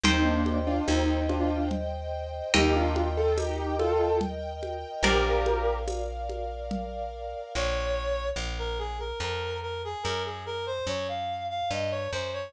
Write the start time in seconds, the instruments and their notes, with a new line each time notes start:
0.03 electric bass (finger) D#2, acoustic grand piano C4 D#4, string ensemble 1 C5 D#5 G5, orchestral harp C5 D#5 G5, low conga
0.25 acoustic grand piano A#3 D4
0.46 high conga
0.67 acoustic grand piano D4 F4
0.88 electric bass (finger) D#2, acoustic grand piano C4 D#4, tambourine, high conga
1.29 acoustic grand piano D4 F4, high conga
1.71 low conga
2.54 electric bass (finger) D#2, acoustic grand piano D#4 G4, orchestral harp A#4 D#5 G5, string ensemble 1 A#4 D#5 G5, low conga
2.76 acoustic grand piano D4 F4
2.96 high conga
3.17 acoustic grand piano F4 A4
3.37 acoustic grand piano D#4 G4, tambourine, high conga
3.79 acoustic grand piano F4 A4, high conga
4.21 low conga
4.63 high conga
5.03 electric bass (finger) A#1, acoustic grand piano G4 A#4, orchestral harp A#4 D5 F5, string ensemble 1 A#4 D5 F5, low conga
5.46 high conga
5.87 tambourine, high conga
6.30 high conga
6.71 low conga
7.55 electric bass (finger) A#1, clarinet C#5
8.36 electric bass (finger) A#1
8.59 clarinet A#4
8.79 clarinet G#4
8.99 clarinet A#4
9.20 electric bass (finger) F2, clarinet A#4
9.62 clarinet A#4
9.85 clarinet G#4
10.03 electric bass (finger) F#2, clarinet A#4
10.25 clarinet G#4
10.46 clarinet A#4
10.66 clarinet C5
10.87 electric bass (finger) F#2, clarinet C#5
11.08 clarinet F5
11.50 clarinet F5
11.70 electric bass (finger) G2, clarinet D#5
11.91 clarinet C#5
12.12 electric bass (finger) F#2, clarinet C5
12.33 clarinet C#5